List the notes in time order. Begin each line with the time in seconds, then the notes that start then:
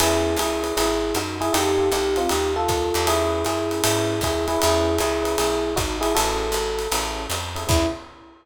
0.00 E2 B3 C#4 E4 G#4, ride
0.36 C#2 E4 G#4, hi-hat pedal, ride
0.63 B3 C#4 E4 G#4, ride
0.77 G#1 E4 G#4, ride
1.14 F#2 D#4 F#4, hi-hat pedal, ride
1.41 E4 G#4, ride
1.53 F2 D#4 F4 G4 A4, ride
1.77 D#4 F4 G4 A4
1.92 C2 D#4 G4, hi-hat pedal, ride
2.16 C4 F4, ride
2.29 D#2 D#4 G4, ride
2.56 F4 A4
2.68 D#2, kick, hi-hat pedal, ride
2.94 E2 D#4 F4 G4 A4, ride
3.07 C#4 E4 G#4 B4, ride
3.45 F#2 E4 G#4, hi-hat pedal, ride
3.71 C#4 E4 G#4 B4, ride
3.83 G#2 C#4 E4 G#4 B4, ride
4.21 D#2 E4 G#4, kick, hi-hat pedal, ride
4.48 C#4 E4 G#4 B4, ride
4.59 E2 C#4 E4 G#4 B4, ride
4.98 C#2 E4 G#4, hi-hat pedal, ride
5.22 C#4 E4 G#4 B4, ride
5.38 B1 E4 G#4, ride
5.76 G#1 D#4 F#4, kick, hi-hat pedal, ride
6.01 E4 G#4, ride
6.15 A1 C#4 E4 F#4 G#4 A4, ride
6.52 G#1, hi-hat pedal, ride
6.79 ride
6.92 A1 C#4 E4 G#4 A4, ride
7.30 F2, hi-hat pedal, ride
7.55 C#4 E4 G#4 A4, ride
7.67 E2 B3 C#4 E4 G#4, kick, crash